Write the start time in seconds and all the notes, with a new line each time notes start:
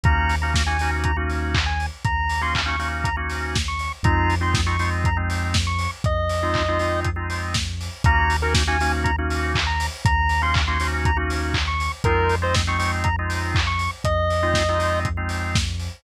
0.03 D#2 A#3 C#4 D#4 F#4 A#5, kick, closed hi-hat
0.29 open hi-hat
0.42 A#3 C#4 D#4 F#4 A#5
0.54 kick, snare
0.66 A#3 C#4 D#4 F#4 G#5
0.79 A#3 C#4 D#4 F#4, open hi-hat
1.04 A#5, kick, closed hi-hat
1.17 A#3 C#4 D#4 F#4
1.30 open hi-hat
1.54 kick, clap
1.66 G#5
1.80 open hi-hat
2.04 D#2 A#5, kick, closed hi-hat
2.29 open hi-hat
2.41 A#3 C#4 D#4 F#4 C6
2.55 kick, clap
2.66 A#3 C#4 D#4 F#4 C#6
2.79 A#3 C#4 D#4 F#4, open hi-hat
3.04 A#5, kick, closed hi-hat
3.17 A#3 C#4 D#4 F#4
3.29 open hi-hat
3.55 kick, snare
3.68 C#6
3.79 open hi-hat
4.03 F2 G#3 C4 D#4 F4 A#5, kick, closed hi-hat
4.30 open hi-hat
4.41 G#3 C4 D#4 F4 C6
4.54 kick, snare
4.66 G#3 C4 D#4 F4 C#6
4.79 G#3 C4 D#4 F4, open hi-hat
5.04 A#5, kick, closed hi-hat
5.17 G#3 C4 D#4 F4
5.30 open hi-hat
5.54 kick, snare
5.67 C#6
5.79 open hi-hat
6.04 F2 D#5, kick, closed hi-hat
6.29 open hi-hat
6.43 G#3 C4 D#4 F4
6.54 kick, clap
6.68 G#3 C4 D#4 F4
6.79 G#3 C4 D#4 F4, open hi-hat
7.04 kick, closed hi-hat
7.16 G#3 C4 D#4 F4
7.30 open hi-hat
7.54 kick, snare
7.81 open hi-hat
8.04 D#2 A#3 C#4 D#4 F#4 A#5, kick, closed hi-hat
8.30 open hi-hat
8.42 A#3 C#4 D#4 F#4 A#4
8.54 kick, snare
8.67 A#3 C#4 D#4 F#4 G#5
8.81 A#3 C#4 D#4 F#4, open hi-hat
9.04 A#5, kick, closed hi-hat
9.18 A#3 C#4 D#4 F#4
9.30 open hi-hat
9.55 kick, clap
9.67 A#5
9.80 open hi-hat
10.05 D#2 A#5, kick, closed hi-hat
10.29 open hi-hat
10.42 A#3 C#4 D#4 F#4 C6
10.54 kick, clap
10.68 A#3 C#4 D#4 F#4 C6
10.80 A#3 C#4 D#4 F#4, open hi-hat
11.05 A#5, kick, closed hi-hat
11.17 A#3 C#4 D#4 F#4
11.30 open hi-hat
11.54 kick, clap
11.68 C#6
11.80 open hi-hat
12.04 F2 G#3 C4 D#4 F4 A#4, kick, closed hi-hat
12.29 open hi-hat
12.42 G#3 C4 D#4 F4 C5
12.54 kick, snare
12.67 G#3 C4 D#4 F4 C#6
12.78 G#3 C4 D#4 F4, open hi-hat
13.04 A#5, kick, closed hi-hat
13.19 G#3 C4 D#4 F4
13.30 open hi-hat
13.55 kick, clap
13.67 C#6
13.79 open hi-hat
14.04 F2 D#5, kick, closed hi-hat
14.30 open hi-hat
14.43 G#3 C4 D#4 F4
14.54 kick, snare
14.69 G#3 C4 D#4 F4
14.79 G#3 C4 D#4 F4, open hi-hat
15.05 kick, closed hi-hat
15.17 G#3 C4 D#4 F4
15.29 open hi-hat
15.55 kick, snare
15.79 open hi-hat